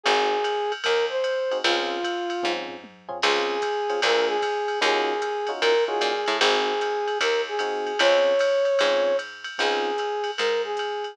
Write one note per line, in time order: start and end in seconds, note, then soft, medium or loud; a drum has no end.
0.03 0.75 G#1 loud
0.03 0.37 C4 medium
0.03 0.37 D#4 medium
0.03 0.37 F#4 medium
0.03 0.72 G#4 loud
0.03 0.37 G#4 medium
0.03 kick medium
0.03 ride loud
0.44 hi-hat pedal medium
0.44 ride medium
0.72 ride medium
0.84 1.54 D#2 medium
0.84 1.05 A#4 medium
0.84 kick medium
0.84 ride loud
1.10 1.58 C5 medium
1.24 hi-hat pedal medium
1.24 ride medium
1.51 1.61 C4 medium
1.51 1.61 D#4 medium
1.51 1.61 F#4 medium
1.51 1.61 G#4 medium
1.51 ride medium
1.64 2.33 C#2 loud
1.64 1.97 C4 medium
1.64 1.97 C#4 medium
1.64 2.52 F4 medium
1.64 1.97 F4 medium
1.64 1.97 G#4 medium
1.64 ride loud
2.03 kick medium
2.03 hi-hat pedal medium
2.03 ride medium
2.30 ride medium
2.43 3.13 G#2 medium
2.43 2.75 C4 medium
2.43 2.75 C#4 medium
2.43 2.75 F4 medium
2.43 2.75 G#4 medium
2.43 kick medium
2.43 high tom medium
2.69 floor tom medium
2.84 high tom medium
3.09 3.18 C4 medium
3.09 3.18 C#4 medium
3.09 3.18 F4 medium
3.09 3.18 G#4 medium
3.09 floor tom loud
3.22 3.92 C#2 loud
3.22 3.56 C4 medium
3.22 3.56 C#4 medium
3.22 3.56 F4 medium
3.22 4.00 G#4 loud
3.22 3.56 G#4 medium
3.22 crash loud
3.22 ride loud
3.62 kick medium
3.62 hi-hat pedal medium
3.62 ride medium
3.89 3.99 C4 medium
3.89 3.99 C#4 medium
3.89 3.99 F4 medium
3.89 3.99 G#4 medium
3.89 ride medium
4.02 4.72 D2 loud
4.02 4.36 A#3 medium
4.02 4.36 D4 medium
4.02 4.36 F4 medium
4.02 4.36 G#4 medium
4.02 4.27 A#4 medium
4.02 kick medium
4.02 ride loud
4.27 4.79 G#4 loud
4.42 kick medium
4.42 hi-hat pedal medium
4.42 ride medium
4.68 ride medium
4.81 5.50 D#2 loud
4.81 5.13 C#4 loud
4.81 5.13 D#4 medium
4.81 5.13 F4 medium
4.81 5.13 F#4 medium
4.81 5.51 G#4 loud
4.81 ride loud
5.22 hi-hat pedal medium
5.22 ride medium
5.47 5.73 C#4 medium
5.47 5.73 D#4 medium
5.47 5.73 F4 medium
5.47 5.73 F#4 medium
5.47 ride medium
5.61 6.00 A#2 medium
5.61 5.84 A#4 medium
5.61 kick medium
5.61 ride loud
5.87 6.12 C#4 medium
5.87 6.12 D#4 medium
5.87 6.12 F4 medium
5.87 6.12 F#4 medium
5.87 6.37 G#4 medium
6.01 6.25 A#2 medium
6.01 hi-hat pedal medium
6.01 ride medium
6.26 6.40 A2 loud
6.26 ride medium
6.40 7.10 G#1 loud
6.40 6.72 C4 medium
6.40 6.72 D#4 medium
6.40 6.72 F#4 medium
6.40 7.18 G#4 loud
6.40 6.72 G#4 medium
6.40 kick medium
6.40 ride loud
6.81 hi-hat pedal medium
6.81 ride medium
7.08 ride medium
7.20 7.89 D#2 medium
7.20 7.41 A#4 medium
7.20 kick medium
7.20 ride loud
7.48 7.99 G#4 medium
7.59 7.92 C4 medium
7.59 7.92 D#4 medium
7.59 7.92 F#4 medium
7.59 7.92 G#4 medium
7.59 hi-hat pedal medium
7.59 ride medium
7.87 ride medium
7.99 8.68 C#2 loud
7.99 8.32 C4 medium
7.99 8.32 C#4 medium
7.99 8.32 F4 medium
7.99 8.32 G#4 medium
7.99 9.17 C#5 loud
7.99 ride loud
8.39 hi-hat pedal medium
8.39 ride loud
8.65 ride medium
8.79 9.49 G#2 loud
8.79 9.12 C4 medium
8.79 9.12 C#4 medium
8.79 9.12 F4 medium
8.79 9.12 G#4 medium
8.79 ride loud
9.19 hi-hat pedal medium
9.19 ride medium
9.44 ride medium
9.58 10.29 C#2 medium
9.58 9.90 C4 medium
9.58 9.90 C#4 medium
9.58 9.90 D#4 medium
9.58 9.90 F4 medium
9.58 10.31 G#4 loud
9.58 kick medium
9.58 ride loud
9.98 hi-hat pedal medium
9.98 ride medium
10.24 ride medium
10.38 11.08 G#2 medium
10.38 10.62 A#4 medium
10.38 ride loud
10.64 11.15 G#4 medium
10.77 hi-hat pedal medium
10.77 ride medium
11.04 ride medium